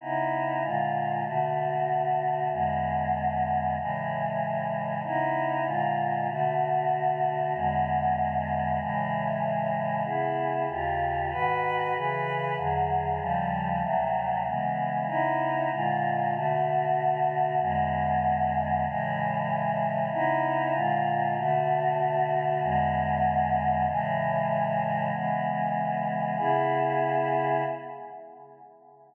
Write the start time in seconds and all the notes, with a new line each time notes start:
0.01 C#3 B3 D#4 E4
0.62 A#2 D3 G#3 F4
1.24 B2 D3 A3 F#4
2.51 E2 D3 G#3 B3
3.77 A2 C#3 E3 G#3
5.03 C#3 B3 D#4 E4
5.65 A#2 D3 G#3 F4
6.29 B2 D3 A3 F#4
7.54 E2 D3 G#3 B3
8.79 A2 C#3 E3 G#3
10.04 C#3 B3 E4 G#4
10.69 D#2 C#3 F4 G4
11.31 G#2 D#3 F#4 B4
11.94 C#3 E3 G#4 B4
12.56 E2 D3 F#3 G#4
13.19 D#2 C#3 F3 G3
13.82 D2 C3 F#3 A3
14.46 C#3 E3 G#3 B3
15.07 C#3 B3 D#4 E4
15.71 A#2 D3 G#3 F4
16.34 B2 D3 A3 F#4
17.59 E2 D3 G#3 B3
18.84 A2 C#3 E3 G#3
20.12 C#3 B3 D#4 E4
20.72 A#2 D3 G#3 F4
21.37 B2 D3 A3 F#4
22.61 E2 D3 G#3 B3
23.87 A2 C#3 E3 G#3
25.12 C#3 E3 G#3 B3
26.38 C#3 B3 E4 G#4